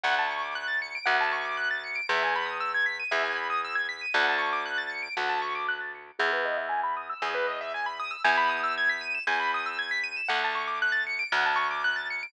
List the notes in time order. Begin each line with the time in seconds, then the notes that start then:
0.04 D2 F#5
0.19 A5
0.31 C#6
0.42 D6
0.55 F#6
0.68 A6
0.82 C#7
0.95 D7
1.06 D2 F#5
1.21 A5
1.32 C#6
1.45 D6
1.57 F#6
1.71 A6
1.84 C#7
1.95 D7
2.09 E2 E5
2.23 G#5
2.36 B5
2.46 D#6
2.60 E6
2.74 G#6
2.86 B6
3.00 D#7
3.11 E2 E5
3.24 G#5
3.36 B5
3.50 D#6
3.65 E6
3.75 G#6
3.89 B6
4.01 D#7
4.14 D2 F#5
4.29 A5
4.38 C#6
4.53 D6
4.66 F#6
4.78 A6
4.90 C#7
5.03 D7
5.17 D2 F#5
5.29 A5
5.42 C#6
5.55 D6
5.69 F#6
5.80 A6
5.95 C#7
6.07 D7
6.19 E2 G#4
6.33 B4
6.45 D#5
6.57 E5
6.69 G#5
6.84 B5
6.97 D#6
7.10 E6
7.22 E2 G#4
7.35 B4
7.47 D#5
7.61 E5
7.74 G#5
7.86 B5
8.00 D#6
8.11 E6
8.24 E2 G#5
8.38 B5
8.49 D#6
8.64 E6
8.78 G#6
8.89 B6
9.01 D#7
9.15 E7
9.27 E2 G#5
9.40 B5
9.54 D#6
9.66 E6
9.79 G#6
9.91 B6
10.04 D#7
10.17 E7
10.29 D2 F#5
10.44 A5
10.55 C#6
10.68 D6
10.82 F#6
10.92 A6
11.07 C#7
11.19 D7
11.32 D2 F#5
11.46 A5
11.56 C#6
11.71 D6
11.84 F#6
11.96 A6
12.10 C#7
12.23 D7